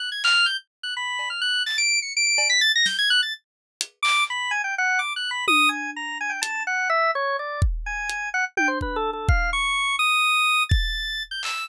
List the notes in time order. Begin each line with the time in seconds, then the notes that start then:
0.00 F#6
0.12 G#6
0.24 F6, clap
0.46 G6
0.83 F#6
0.97 B5
1.19 cowbell
1.30 F6
1.41 F#6
1.66 A6, clap
1.78 D7
2.02 C#7
2.17 D7
2.27 D7
2.38 cowbell
2.50 B6
2.61 A6
2.75 A#6
2.86 G6, snare
2.99 G#6
3.10 F#6
3.23 A6
3.81 closed hi-hat
4.03 D6, clap
4.30 B5
4.51 G#5
4.64 G5
4.78 F#5
4.99 D6
5.16 F#6
5.31 B5
5.48 D#6, high tom
5.69 G#5
5.96 A#5
6.21 G#5
6.30 G5
6.42 A5, closed hi-hat
6.67 F#5
6.90 E5
7.15 C#5
7.39 D5
7.62 kick
7.86 G#5
8.10 closed hi-hat
8.34 F#5
8.57 G5, high tom
8.68 C5
8.81 B4, kick
8.96 A4
9.13 A4
9.29 F5, kick
9.53 C#6
9.99 D#6
10.69 A6, kick
11.31 G6
11.43 E6, clap